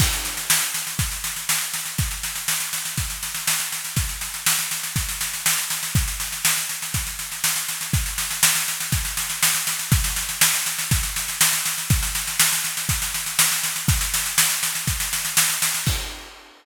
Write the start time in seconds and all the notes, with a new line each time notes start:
0.00 kick, snare, crash
0.13 snare
0.25 snare
0.37 snare
0.50 snare
0.62 snare
0.74 snare
0.87 snare
0.99 kick, snare
1.12 snare
1.24 snare
1.36 snare
1.49 snare
1.61 snare
1.74 snare
1.86 snare
1.98 kick, snare
2.11 snare
2.23 snare
2.35 snare
2.48 snare
2.60 snare
2.73 snare
2.85 snare
2.97 kick, snare
3.10 snare
3.23 snare
3.35 snare
3.47 snare
3.60 snare
3.72 snare
3.85 snare
3.96 kick, snare
4.09 snare
4.21 snare
4.34 snare
4.46 snare
4.59 snare
4.71 snare
4.83 snare
4.96 kick, snare
5.09 snare
5.21 snare
5.33 snare
5.46 snare
5.58 snare
5.70 snare
5.83 snare
5.95 kick, snare
6.08 snare
6.20 snare
6.32 snare
6.45 snare
6.57 snare
6.69 snare
6.82 snare
6.94 kick, snare
7.07 snare
7.19 snare
7.32 snare
7.44 snare
7.56 snare
7.68 snare
7.81 snare
7.93 kick, snare
8.06 snare
8.18 snare
8.31 snare
8.43 snare
8.55 snare
8.68 snare
8.80 snare
8.92 kick, snare
9.05 snare
9.17 snare
9.30 snare
9.43 snare
9.55 snare
9.67 snare
9.79 snare
9.92 kick, snare
10.04 snare
10.16 snare
10.29 snare
10.41 snare
10.54 snare
10.66 snare
10.79 snare
10.91 kick, snare
11.03 snare
11.16 snare
11.28 snare
11.41 snare
11.53 snare
11.65 snare
11.78 snare
11.90 kick, snare
12.03 snare
12.15 snare
12.27 snare
12.40 snare
12.52 snare
12.64 snare
12.77 snare
12.89 kick, snare
13.02 snare
13.14 snare
13.26 snare
13.39 snare
13.52 snare
13.63 snare
13.76 snare
13.88 kick, snare
14.01 snare
14.14 snare
14.26 snare
14.38 snare
14.50 snare
14.63 snare
14.75 snare
14.87 kick, snare
15.00 snare
15.13 snare
15.25 snare
15.37 snare
15.49 snare
15.62 snare
15.74 snare
15.86 kick, crash